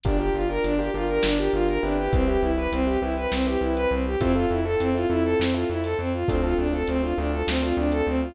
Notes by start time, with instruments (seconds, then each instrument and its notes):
0.04 synth bass 1 G1, violin D4, acoustic grand piano D4 F4 G4 A#4, kick, closed hi-hat
0.20 acoustic grand piano D4 F4 G4 A#4, violin G4
0.34 synth bass 1 G1, violin F4
0.49 acoustic grand piano D4 F4 G4 A#4, violin A#4
0.64 synth bass 1 G1, violin D4, closed hi-hat
0.79 acoustic grand piano D4 F4 G4 A#4, violin G4
0.94 synth bass 1 G1, acoustic grand piano D4 F4 G4 A#4, violin F4
1.09 violin A#4
1.23 synth bass 1 G1, violin D4, snare
1.38 acoustic grand piano D4 F4 G4 A#4, violin G4
1.53 synth bass 1 G1, violin F4
1.68 violin A#4, closed hi-hat
1.83 synth bass 1 G1, acoustic grand piano C4 E4 G4 B4, violin D4
1.98 violin G4
2.13 synth bass 1 C2, violin C4, kick, closed hi-hat
2.28 acoustic grand piano C4 E4 G4 B4, violin G4
2.42 synth bass 1 C2, violin E4
2.57 acoustic grand piano C4 E4 G4 B4, violin B4
2.72 synth bass 1 C2, violin C4, closed hi-hat
2.87 acoustic grand piano C4 E4 G4 B4, violin G4
3.02 synth bass 1 C2, acoustic grand piano C4 E4 G4 B4, violin E4
3.17 violin B4
3.32 synth bass 1 C2, violin C4, snare
3.46 acoustic grand piano C4 E4 G4 B4, violin G4
3.61 synth bass 1 C2, violin E4
3.76 violin B4, closed hi-hat
3.91 synth bass 1 C2, violin C4
4.06 violin G4
4.21 synth bass 1 F2, violin C4, acoustic grand piano C4 E4 F4 A4, kick, closed hi-hat
4.35 acoustic grand piano C4 E4 F4 A4, violin F4
4.50 synth bass 1 F2, violin E4
4.65 acoustic grand piano C4 E4 F4 A4, violin A4
4.80 synth bass 1 F2, violin C4, closed hi-hat
4.95 acoustic grand piano C4 E4 F4 A4, violin F4
5.10 synth bass 1 F2, acoustic grand piano C4 E4 F4 A4, violin E4
5.25 violin A4
5.39 synth bass 1 F2, violin C4, snare
5.54 acoustic grand piano C4 E4 F4 A4, violin F4
5.69 synth bass 1 F2, violin E4
5.84 violin A4, open hi-hat
5.99 synth bass 1 F2, violin C4
6.14 violin F4
6.28 synth bass 1 D2, acoustic grand piano C4 D4 F4 A4, violin C4, kick, closed hi-hat
6.43 acoustic grand piano C4 D4 F4 A4, violin F4
6.58 synth bass 1 D2, violin D4
6.73 acoustic grand piano C4 D4 F4 A4, violin A4
6.87 synth bass 1 D2, violin C4, closed hi-hat
7.03 acoustic grand piano C4 D4 F4 A4, violin F4
7.18 synth bass 1 D2, acoustic grand piano C4 D4 F4 A4, violin D4
7.33 violin A4
7.47 synth bass 1 D2, violin C4, snare
7.62 acoustic grand piano C4 D4 F4 A4, violin F4
7.77 synth bass 1 D2, violin D4
7.92 violin A4, closed hi-hat
8.07 synth bass 1 D2, violin C4
8.22 violin F4